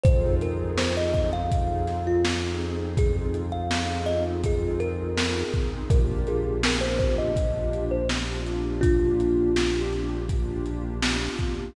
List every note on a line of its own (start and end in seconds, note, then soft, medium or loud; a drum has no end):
0.04 5.43 F2 loud
0.04 0.71 C4 loud
0.04 0.71 D#4 loud
0.04 0.71 F4 loud
0.04 0.71 G#4 loud
0.04 0.35 C5 loud
0.04 kick loud
0.04 closed hi-hat loud
0.41 0.72 A#4 medium
0.41 closed hi-hat medium
0.78 1.44 C4 medium
0.78 1.44 D#4 loud
0.78 1.44 F4 medium
0.78 1.44 G#4 loud
0.78 0.95 C5 medium
0.78 snare loud
0.97 1.13 D#5 loud
1.13 1.31 D#5 medium
1.13 kick medium
1.13 closed hi-hat medium
1.33 1.97 F5 loud
1.51 2.17 C4 medium
1.51 2.17 D#4 medium
1.51 2.17 F4 loud
1.51 2.17 G#4 medium
1.51 kick loud
1.51 closed hi-hat loud
1.87 snare soft
1.87 closed hi-hat medium
2.07 2.24 F4 medium
2.25 2.91 C4 medium
2.25 2.91 D#4 loud
2.25 2.91 F4 medium
2.25 2.91 G#4 loud
2.25 snare loud
2.61 closed hi-hat medium
2.97 3.63 C4 medium
2.97 3.63 D#4 medium
2.97 3.63 F4 loud
2.97 3.63 G#4 medium
2.97 3.16 G#4 loud
2.97 kick loud
2.97 closed hi-hat loud
3.34 closed hi-hat medium
3.52 3.98 F5 medium
3.71 4.37 C4 loud
3.71 4.37 D#4 loud
3.71 4.37 F4 loud
3.71 4.37 G#4 medium
3.71 snare loud
4.06 4.23 D#5 loud
4.06 closed hi-hat medium
4.44 5.10 C4 loud
4.44 5.10 D#4 loud
4.44 5.10 F4 loud
4.44 5.10 G#4 medium
4.44 4.82 G#4 loud
4.44 kick medium
4.44 closed hi-hat loud
4.80 5.42 A#4 loud
4.80 closed hi-hat medium
5.17 5.83 C4 loud
5.17 5.83 D#4 loud
5.17 5.83 F4 medium
5.17 5.83 G#4 loud
5.17 snare loud
5.54 kick medium
5.54 closed hi-hat medium
5.90 11.29 A#1 loud
5.90 6.56 A#3 loud
5.90 6.56 D4 medium
5.90 6.56 F4 loud
5.90 6.56 G4 loud
5.90 6.26 A#4 loud
5.90 kick loud
5.90 closed hi-hat loud
6.27 6.61 G#4 loud
6.27 closed hi-hat medium
6.63 7.30 A#3 loud
6.63 7.30 D4 medium
6.63 7.30 F4 loud
6.63 7.30 G4 loud
6.63 6.83 A#4 loud
6.63 snare loud
6.81 6.98 C5 loud
6.99 7.16 C5 loud
6.99 kick medium
6.99 closed hi-hat medium
7.18 7.85 D#5 loud
7.36 8.02 A#3 medium
7.36 8.02 D4 loud
7.36 8.02 F4 medium
7.36 8.02 G4 medium
7.36 kick medium
7.36 closed hi-hat loud
7.73 closed hi-hat medium
7.91 8.09 C5 loud
8.09 8.75 A#3 medium
8.09 8.75 D4 loud
8.09 8.75 F4 loud
8.09 8.75 G4 medium
8.09 snare loud
8.46 closed hi-hat medium
8.81 9.49 A#3 loud
8.81 9.81 D4 loud
8.81 9.49 D4 loud
8.81 9.81 F4 loud
8.81 9.49 F4 loud
8.81 9.49 G4 medium
8.81 kick loud
8.81 closed hi-hat loud
9.20 closed hi-hat medium
9.56 10.22 A#3 medium
9.56 10.22 D4 loud
9.56 10.22 F4 medium
9.56 10.22 G4 loud
9.56 snare loud
9.56 closed hi-hat medium
9.93 closed hi-hat medium
10.29 10.95 A#3 loud
10.29 10.95 D4 loud
10.29 10.95 F4 loud
10.29 10.95 G4 loud
10.29 kick medium
10.29 closed hi-hat loud
10.66 closed hi-hat medium
11.02 11.68 A#3 loud
11.02 11.68 D4 medium
11.02 11.68 F4 loud
11.02 11.68 G4 loud
11.02 snare loud
11.39 kick medium
11.39 closed hi-hat medium